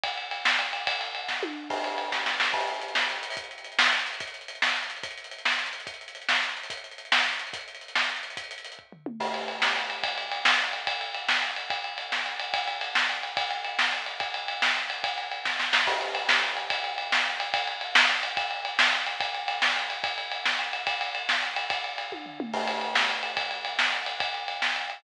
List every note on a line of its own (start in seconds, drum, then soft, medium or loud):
0.03 kick loud
0.03 ride loud
0.18 ride medium
0.31 ride medium
0.45 snare loud
0.59 ride medium
0.73 ride medium
0.87 kick loud
0.87 ride loud
1.01 ride medium
1.15 ride medium
1.28 kick medium
1.28 snare medium
1.43 high tom medium
1.70 kick loud
1.70 crash loud
1.84 ride medium
1.98 ride medium
2.12 kick medium
2.12 snare medium
2.26 snare medium
2.40 snare loud
2.53 kick loud
2.53 crash loud
2.61 closed hi-hat medium
2.67 closed hi-hat medium
2.74 closed hi-hat medium
2.82 closed hi-hat medium
2.88 closed hi-hat medium
2.95 snare loud
3.02 closed hi-hat medium
3.09 closed hi-hat medium
3.16 closed hi-hat medium
3.23 closed hi-hat loud
3.30 open hi-hat medium
3.37 kick loud
3.37 closed hi-hat loud
3.44 closed hi-hat medium
3.51 closed hi-hat medium
3.58 closed hi-hat medium
3.64 closed hi-hat medium
3.72 closed hi-hat medium
3.79 snare loud
3.86 closed hi-hat medium
3.93 closed hi-hat medium
3.99 closed hi-hat medium
4.07 closed hi-hat medium
4.13 closed hi-hat medium
4.20 kick loud
4.20 closed hi-hat loud
4.27 closed hi-hat medium
4.34 closed hi-hat medium
4.41 closed hi-hat medium
4.48 closed hi-hat loud
4.55 closed hi-hat medium
4.62 snare loud
4.69 closed hi-hat medium
4.76 closed hi-hat medium
4.83 closed hi-hat medium
4.90 closed hi-hat medium
4.96 closed hi-hat medium
5.03 kick loud
5.03 closed hi-hat loud
5.11 closed hi-hat medium
5.18 closed hi-hat medium
5.24 closed hi-hat medium
5.31 closed hi-hat medium
5.38 closed hi-hat medium
5.45 snare loud
5.52 closed hi-hat medium
5.59 closed hi-hat medium
5.66 closed hi-hat medium
5.73 closed hi-hat medium
5.80 closed hi-hat medium
5.87 kick loud
5.87 closed hi-hat loud
5.94 closed hi-hat medium
6.01 closed hi-hat medium
6.08 closed hi-hat medium
6.15 closed hi-hat medium
6.22 closed hi-hat medium
6.29 snare loud
6.35 closed hi-hat medium
6.43 closed hi-hat medium
6.49 closed hi-hat medium
6.57 closed hi-hat medium
6.63 closed hi-hat medium
6.70 kick loud
6.70 closed hi-hat loud
6.77 closed hi-hat medium
6.84 closed hi-hat medium
6.91 closed hi-hat medium
6.98 closed hi-hat medium
7.05 closed hi-hat medium
7.12 snare loud
7.19 closed hi-hat medium
7.26 closed hi-hat medium
7.33 closed hi-hat medium
7.39 closed hi-hat medium
7.47 closed hi-hat medium
7.53 kick loud
7.53 closed hi-hat loud
7.61 closed hi-hat medium
7.68 closed hi-hat medium
7.75 closed hi-hat medium
7.81 closed hi-hat medium
7.88 closed hi-hat medium
7.95 snare loud
8.02 closed hi-hat medium
8.09 closed hi-hat medium
8.16 closed hi-hat medium
8.23 closed hi-hat medium
8.30 closed hi-hat medium
8.37 kick loud
8.37 closed hi-hat loud
8.44 closed hi-hat medium
8.51 closed hi-hat loud
8.58 closed hi-hat medium
8.65 closed hi-hat medium
8.72 closed hi-hat medium
8.79 kick medium
8.92 floor tom medium
9.06 mid tom loud
9.20 kick medium
9.20 crash loud
9.34 ride medium
9.48 ride medium
9.62 snare loud
9.76 ride medium
9.90 ride medium
10.03 kick loud
10.03 ride loud
10.18 ride medium
10.32 ride medium
10.45 snare loud
10.59 ride medium
10.73 ride medium
10.87 kick loud
10.87 ride loud
11.01 ride medium
11.14 ride medium
11.28 snare loud
11.42 ride medium
11.56 ride medium
11.70 kick loud
11.70 ride medium
11.84 ride medium
11.98 ride medium
12.12 snare medium
12.26 ride medium
12.40 ride medium
12.54 kick loud
12.54 ride loud
12.68 ride medium
12.81 ride medium
12.95 snare loud
13.09 ride medium
13.23 ride medium
13.37 kick loud
13.37 ride loud
13.51 ride medium
13.65 ride medium
13.79 snare loud
13.92 ride medium
14.06 ride medium
14.20 kick loud
14.20 ride medium
14.34 ride medium
14.48 ride medium
14.62 snare loud
14.76 ride medium
14.90 ride medium
15.04 kick loud
15.04 ride loud
15.18 ride medium
15.31 ride medium
15.45 kick medium
15.45 snare medium
15.59 snare medium
15.73 snare loud
15.87 kick loud
15.87 crash loud
16.01 ride medium
16.15 ride medium
16.29 snare loud
16.43 ride medium
16.57 ride medium
16.70 kick loud
16.70 ride loud
16.84 ride medium
16.98 ride medium
17.12 snare loud
17.26 ride medium
17.40 ride medium
17.54 kick loud
17.54 ride loud
17.67 ride medium
17.81 ride medium
17.95 snare loud
18.09 ride medium
18.23 ride medium
18.37 kick loud
18.37 ride loud
18.51 ride medium
18.65 ride medium
18.79 snare loud
18.93 ride medium
19.06 ride medium
19.20 kick loud
19.20 ride loud
19.34 ride medium
19.48 ride medium
19.62 snare loud
19.76 ride medium
19.90 ride medium
20.04 kick loud
20.04 ride loud
20.18 ride medium
20.32 ride medium
20.45 snare loud
20.59 ride medium
20.73 ride medium
20.87 kick loud
20.87 ride loud
21.01 ride medium
21.15 ride medium
21.29 snare loud
21.42 ride medium
21.56 ride medium
21.70 kick loud
21.70 ride loud
21.84 ride medium
21.98 ride medium
22.12 kick medium
22.12 high tom medium
22.26 floor tom medium
22.40 mid tom loud
22.53 kick loud
22.53 crash loud
22.67 ride medium
22.81 ride medium
22.95 snare loud
23.09 ride medium
23.23 ride medium
23.37 kick loud
23.37 ride loud
23.51 ride medium
23.65 ride medium
23.79 snare loud
23.93 ride medium
24.06 ride medium
24.20 kick loud
24.20 ride loud
24.34 ride medium
24.48 ride medium
24.62 snare loud
24.76 ride medium
24.90 ride medium